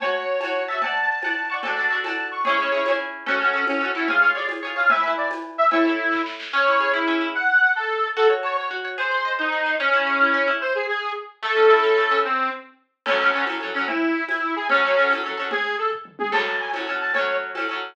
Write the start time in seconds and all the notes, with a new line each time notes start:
0.00 F#4 C#5 A5, cowbell, low conga
0.40 C#5 A5, tambourine, cowbell, high conga
0.45 F#4
0.68 C#5 E5 A5
0.72 F#4
0.81 F#5 A5, cowbell, low conga
0.86 D5
1.22 F#5 A5, tambourine, cowbell, high conga
1.26 D5
1.50 D5 F#5 A5 C#6
1.63 F#4 A4 A5, cowbell, low conga
1.67 D4
1.77 D4 F#4 A4
1.90 D4 F#4 A4
2.04 D4 F#4 A4 A5, tambourine, cowbell, high conga
2.31 C#6
2.45 E4 G#4 C#5, cowbell, low conga
2.49 C#4
2.58 C#4 E4 G#4
2.72 C#4 E4 G#4
2.85 E4 G#4, tambourine, cowbell, high conga
2.90 C#4
3.26 C#4 F#4 A4, cowbell, low conga
3.40 C#4 F#4 A4
3.53 C#4 F#4 A4
3.67 C#4, tambourine, cowbell, high conga
3.81 C#4 F#4 A4
3.95 E4 F#4 A4
3.99 C#4
4.08 G#4 C#5 F5, cowbell, low conga
4.12 F4
4.22 F4 G#4 C#5
4.35 F4 G#4 C#5 D5
4.49 tambourine, cowbell, high conga
4.63 F4 G#4 C#5
4.76 F4 G#4 C#5 F5
4.90 B4 E5 G#5, cowbell, low conga
4.94 E4
5.04 E4 B4 G#5
5.17 D5
5.30 tambourine, cowbell, high conga
5.58 E5
5.71 E4 A4 C#5 E5, cowbell, low conga
5.85 A4 C#5 E5
6.12 kick, snare
6.26 snare
6.40 snare
6.53 C#4 C#5
6.67 E4
6.80 G#4
6.94 E4
7.08 C#4
7.21 E4
7.35 F#5
7.76 A4
8.16 F#4 A4
8.30 C#5
8.43 C#5 A5
8.57 C#5
8.71 F#4
8.85 C#5
8.98 G#4 C5
9.11 C5
9.25 D#5
9.39 D#4 C5
9.52 G#4
9.66 C5
9.80 C#4
9.93 E4
10.07 G#4
10.21 E4
10.34 C#4
10.48 E4
10.61 C5
10.75 G#4
10.89 G#4
11.43 A3 A4
11.56 C#4
11.70 E4
11.84 C#4
11.97 A3
12.11 C#4
12.25 C4
13.06 C#4 A4, crash, cowbell, low conga
13.10 F#3
13.20 F#3 C#4 A4
13.33 C#4 A4
13.37 F#3
13.47 C#4 A4, tambourine, cowbell, high conga
13.51 F#3
13.61 F#3 C#4 A4
13.74 F#3 C#4 A4
13.88 E4, cowbell, low conga
14.29 E4, tambourine, cowbell, high conga
14.56 G#4
14.69 C#4 A4, cowbell, low conga
14.73 F#3
14.83 F#3 C#4 A4
14.97 F#3 C#4 A4
15.10 C#4 A4, tambourine, cowbell, high conga
15.14 F#3
15.24 F#3 C#4 A4
15.37 F#3 C#4 A4
15.51 G#4, cowbell, low conga
15.78 A4
15.92 kick
16.05 mid tom
16.19 G#4, high tom
16.32 F#3 C#4 A4 A5, crash, cowbell, low conga
16.60 G#5
16.73 C#4 A4, tambourine, cowbell, high conga
16.77 F#3
16.87 F#3 C#4 A4
17.01 A5
17.14 C#4 A4 C#5, cowbell, low conga
17.18 F#3
17.55 C#4 A4, tambourine, cowbell, high conga
17.59 F#3
17.69 F#3 C#4 A4